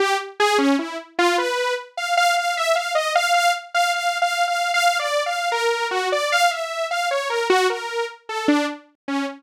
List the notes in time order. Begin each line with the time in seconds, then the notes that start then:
0.00 G4
0.40 G#4
0.58 C#4
0.79 E4
1.19 F4
1.38 B4
1.97 F5
2.17 F5
2.37 F5
2.57 E5
2.75 F5
2.95 D#5
3.15 F5
3.34 F5
3.75 F5
3.94 F5
4.22 F5
4.48 F5
4.74 F5
4.99 D5
5.26 F5
5.52 A#4
5.91 F#4
6.12 D5
6.32 F5
6.51 E5
6.91 F5
7.11 C#5
7.30 A#4
7.50 F#4
7.70 A#4
8.29 A4
8.48 D4
9.08 C#4